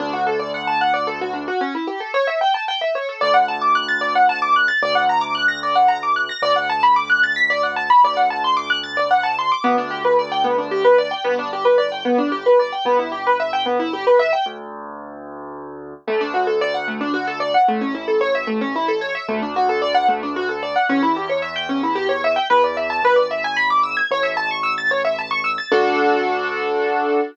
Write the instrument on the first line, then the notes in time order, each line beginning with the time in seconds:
acoustic grand piano
0.00 D2 D4
0.13 F#4
0.27 A4
0.39 D5
0.54 F#5
0.67 A5
0.81 F#5
0.94 D5
1.07 A4
1.21 F#4
1.33 D4
1.48 F#4
1.61 C#4
1.75 E4
1.87 G4
2.00 A4
2.14 C#5
2.27 E5
2.41 G5
2.54 A5
2.68 G5
2.81 E5
2.95 C#5
3.09 A4
3.21 D2 D5
3.34 F#5
3.48 A5
3.61 D6
3.75 F#6
3.89 A6
4.01 D5
4.15 F#5
4.29 A5
4.42 D6
4.56 F#6
4.68 A6
4.82 D2 D5
4.95 F#5
5.09 A#5
5.21 D6
5.35 F#6
5.48 A#6
5.63 D5
5.75 F#5
5.88 A#5
6.03 D6
6.16 F#6
6.29 A#6
6.42 D2 D5
6.56 F#5
6.70 A5
6.83 B5
6.96 D6
7.10 F#6
7.23 A6
7.36 B6
7.50 D5
7.63 F#5
7.76 A5
7.90 B5
8.04 D2 D5
8.17 F#5
8.30 A5
8.44 C6
8.57 D6
8.70 F#6
8.83 A6
8.97 D5
9.11 F#5
9.23 A5
9.39 C6
9.52 D6
9.64 D2 B3
9.78 D4
9.91 G4
10.05 B4
10.19 D5
10.32 G5
10.44 B3
10.58 D4
10.71 G4
10.84 B4
10.98 D5
11.11 G5
11.24 G1 B3
11.39 D4
11.53 G4
11.65 B4
11.78 D5
11.92 G5
12.05 B3
12.18 D4
12.32 G4
12.46 B4
12.59 D5
12.73 G5
12.85 G1 B3
12.99 E4
13.12 G4
13.27 B4
13.40 E5
13.53 G5
13.66 B3
13.80 E4
13.93 G4
14.07 B4
14.19 E5
14.33 G5
14.46 D2
16.07 D2 A3
16.21 D4
16.34 F#4
16.47 A4
16.61 D5
16.74 F#5
16.88 A3
17.01 D4
17.14 F#4
17.27 A4
17.40 D5
17.54 F#5
17.68 A1 A3
17.81 C#4
17.95 E4
18.08 A4
18.21 C#5
18.35 E5
18.47 A3
18.61 C#4
18.76 E4
18.88 A4
19.01 C#5
19.15 E5
19.28 D2 A3
19.42 D4
19.56 F#4
19.69 A4
19.82 D5
19.95 F#5
20.08 A3
20.23 D4
20.36 F#4
20.49 A4
20.63 D5
20.76 F#5
20.89 E2 C#4
21.03 E4
21.16 G4
21.29 C#5
21.42 E5
21.56 G5
21.69 C#4
21.83 E4
21.95 G4
22.09 C#5
22.24 E5
22.36 G5
22.50 E2 B4
22.64 D5
22.77 E5
22.90 A5
23.02 G#1 B4
23.16 D5
23.31 E5
23.44 G#5
23.57 B5
23.70 D6
23.83 E6
23.97 G#6
24.11 A1 C#5
24.23 E5
24.37 A5
24.51 C#6
24.63 E6
24.78 A6
24.91 C#5
25.05 E5
25.19 A5
25.31 C#6
25.44 E6
25.58 A6
25.72 D2 D4 F#4 A4